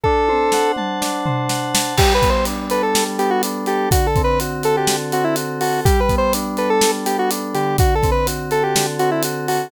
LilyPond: <<
  \new Staff \with { instrumentName = "Lead 1 (square)" } { \time 4/4 \key g \major \tempo 4 = 124 a'4. r2 r8 | \tuplet 3/2 { g'8 b'8 c''8 } r8 b'16 a'8 r16 g'16 fis'16 r8 g'8 | \tuplet 3/2 { fis'8 a'8 b'8 } r8 a'16 g'8 r16 fis'16 e'16 r8 fis'8 | \tuplet 3/2 { g'8 b'8 c''8 } r8 b'16 a'8 r16 g'16 fis'16 r8 g'8 |
\tuplet 3/2 { fis'8 a'8 b'8 } r8 a'16 g'8 r16 fis'16 e'16 r8 fis'8 | }
  \new Staff \with { instrumentName = "Electric Piano 2" } { \time 4/4 \key g \major d'8 c''8 fis''8 a''8 d'8 c''8 fis''8 a''8 | g8 b8 d'8 a'8 g8 b8 d'8 a'8 | d8 c'8 fis'8 a'8 d8 c'8 fis'8 a'8 | g8 b8 d'8 a'8 g8 b8 d'8 d8~ |
d8 c'8 fis'8 a'8 d8 c'8 fis'8 a'8 | }
  \new DrumStaff \with { instrumentName = "Drums" } \drummode { \time 4/4 bd8 tommh8 sn8 toml8 sn8 tomfh8 sn8 sn8 | <cymc bd>8 <hh bd>8 hh8 hh8 sn8 hh8 hh8 hh8 | <hh bd>8 <hh bd>8 hh8 hh8 sn8 hh8 hh8 hho8 | <hh bd>8 <hh bd>8 hh8 hh8 sn8 hh8 hh8 hh8 |
<hh bd>8 <hh bd>8 hh8 hh8 sn8 hh8 hh8 hho8 | }
>>